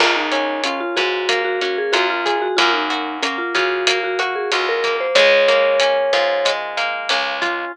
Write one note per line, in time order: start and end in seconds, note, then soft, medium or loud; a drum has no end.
0.00 0.83 C#2 medium
0.00 1.28 A#3 medium
0.00 0.15 F4 medium
0.00 kick medium
0.00 cross-stick medium
0.00 crash medium
0.16 0.61 D#4 medium
0.32 1.61 C#4 medium
0.32 closed hi-hat medium
0.64 0.80 C#4 medium
0.64 1.93 F4 medium
0.64 closed hi-hat medium
0.81 0.96 F4 medium
0.96 1.80 G#2 medium
0.96 1.41 F#4 medium
0.96 2.25 G#4 medium
0.96 kick medium
0.96 cross-stick medium
0.96 closed hi-hat medium
1.29 2.51 A#3 medium
1.29 kick medium
1.29 closed hi-hat medium
1.44 1.60 F#4 medium
1.61 2.53 C#4 medium
1.61 1.77 F#4 medium
1.61 closed hi-hat medium
1.78 1.94 G#4 medium
1.92 2.48 F#2 medium
1.92 2.55 F4 medium
1.92 2.08 F#4 medium
1.92 cross-stick medium
1.92 closed hi-hat medium
2.10 2.36 F4 medium
2.26 2.56 G#4 medium
2.26 kick medium
2.26 closed hi-hat medium
2.42 2.57 F#4 medium
2.57 3.41 F#2 medium
2.57 3.22 A#3 loud
2.57 2.72 F4 medium
2.57 kick medium
2.57 closed hi-hat medium
2.74 3.18 D#4 medium
2.90 4.19 F#4 medium
2.90 closed hi-hat medium
3.22 3.87 A#3 medium
3.22 3.38 C#4 medium
3.22 cross-stick medium
3.22 closed hi-hat medium
3.38 3.53 F4 medium
3.55 4.37 C#3 medium
3.55 4.51 F4 medium
3.55 3.99 F#4 medium
3.55 kick medium
3.55 closed hi-hat medium
3.87 4.84 A#3 medium
3.87 kick medium
3.87 closed hi-hat loud
4.04 4.19 F#4 medium
4.19 4.35 F#4 medium
4.19 5.11 F#4 medium
4.19 cross-stick medium
4.19 closed hi-hat medium
4.35 4.51 G#4 medium
4.52 5.07 C#2 medium
4.52 5.13 F4 medium
4.52 4.67 F#4 medium
4.52 closed hi-hat medium
4.69 4.97 A#4 medium
4.84 5.15 A#3 medium
4.84 kick medium
4.84 closed hi-hat medium
5.00 5.16 C5 medium
5.15 5.97 C#2 medium
5.15 6.45 G#3 loud
5.15 6.52 C#5 loud
5.15 kick medium
5.15 cross-stick medium
5.15 closed hi-hat medium
5.48 6.77 A#3 medium
5.48 closed hi-hat medium
5.80 7.10 C#4 medium
5.80 closed hi-hat medium
6.13 6.95 G#2 medium
6.13 7.41 F4 medium
6.13 kick medium
6.13 cross-stick medium
6.13 closed hi-hat medium
6.45 7.68 G#3 medium
6.45 kick medium
6.45 closed hi-hat medium
6.77 7.69 A#3 medium
6.77 closed hi-hat medium
7.09 7.65 C#2 medium
7.09 7.71 C#4 medium
7.09 cross-stick medium
7.09 closed hi-hat medium
7.42 7.72 F4 medium
7.42 kick medium
7.42 closed hi-hat medium